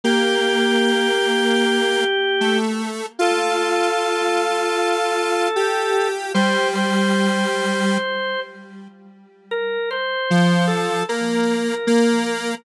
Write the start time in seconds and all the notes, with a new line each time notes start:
0.04 A#3 G4
2.40 A3
3.19 F4 A4
5.56 G4
6.34 G3 C5
6.75 C5
9.51 A#4
9.91 C5
10.30 F3
10.67 A4
11.09 A#3 A#4
11.87 A#3